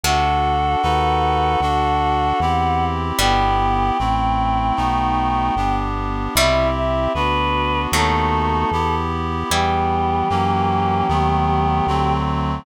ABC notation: X:1
M:4/4
L:1/8
Q:1/4=76
K:Em
V:1 name="Choir Aahs"
f8 | g8 | e e B2 A3 z | G8 |]
V:2 name="Pizzicato Strings"
[C,A,]4 z4 | [B,,G,]8 | [B,,G,] z3 [A,,F,]4 | [G,E]8 |]
V:3 name="Clarinet"
[DFA]2 [^DFAB]2 [=DFA]2 [CEG]2 | [B,EG]2 [A,CE]2 [A,B,^DF]2 [B,=DG]2 | [CEG]2 [B,DF]2 [A,B,^DF]2 [B,EG]2 | [E,G,B,]2 [E,F,^A,^C]2 [^D,F,=A,B,]2 [=D,F,A,=C]2 |]
V:4 name="Synth Bass 1" clef=bass
D,,2 ^D,,2 =D,,2 E,,2 | G,,,2 A,,,2 B,,,2 G,,,2 | C,,2 D,,2 ^D,,2 E,,2 | E,,2 F,,2 ^D,,2 =D,,2 |]